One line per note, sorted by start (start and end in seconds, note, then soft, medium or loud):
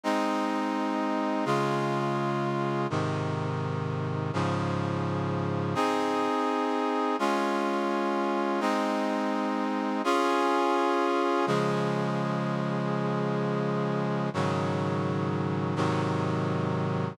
0.04 1.45 G#3 medium
0.04 1.45 C4 medium
0.04 1.45 D#4 medium
1.45 2.87 C#3 medium
1.45 2.87 G#3 medium
1.45 2.87 F4 medium
2.90 4.31 G#2 medium
2.90 4.31 C3 medium
2.90 4.31 D#3 medium
4.33 5.75 G#2 medium
4.33 5.75 C#3 medium
4.33 5.75 F3 medium
5.75 7.16 C4 medium
5.75 7.16 D#4 medium
5.75 7.16 G#4 medium
7.19 8.60 G#3 medium
7.19 8.60 C#4 medium
7.19 8.60 F4 medium
8.60 10.02 G#3 medium
8.60 10.02 C4 medium
8.60 10.02 D#4 medium
10.04 11.46 C#4 medium
10.04 11.46 F4 loud
10.04 11.46 G#4 medium
11.47 14.29 C#3 medium
11.47 14.29 F3 medium
11.47 14.29 G#3 medium
14.34 15.75 G#2 medium
14.34 15.75 C#3 medium
14.34 15.75 D#3 medium
14.34 15.75 F#3 medium
15.76 17.17 G#2 medium
15.76 17.17 C3 medium
15.76 17.17 D#3 medium
15.76 17.17 F#3 medium